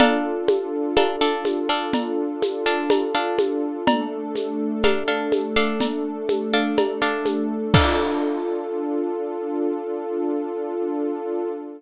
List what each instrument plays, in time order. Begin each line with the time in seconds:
0.00 pizzicato strings D4 A4 F5, pad 2 (warm) D4 F4 A4, cowbell, low conga, shaker
0.48 high conga, shaker
0.97 pizzicato strings D4 A4 F5, cowbell, high conga, shaker
1.21 pizzicato strings D4 A4 F5
1.45 high conga, shaker
1.69 pizzicato strings D4 A4 F5
1.93 cowbell, low conga, shaker
2.42 high conga, shaker
2.66 pizzicato strings D4 A4 F5
2.90 cowbell, high conga, shaker
3.15 pizzicato strings D4 A4 F5
3.39 high conga, shaker
3.86 pad 2 (warm) A3 D4 A4, cowbell, low conga, shaker
4.35 high conga, shaker
4.83 pizzicato strings D4 A4 F5, cowbell, high conga, shaker
5.08 pizzicato strings D4 A4 F5
5.32 high conga, shaker
5.56 pizzicato strings D4 A4 F5
5.80 cowbell, low conga, shaker
6.29 high conga, shaker
6.53 pizzicato strings D4 A4 F5
6.77 cowbell, high conga, shaker
7.02 pizzicato strings D4 A4 F5
7.26 high conga, shaker
7.74 pad 2 (warm) D4 F4 A4, pizzicato strings D4 A4 F5, kick, crash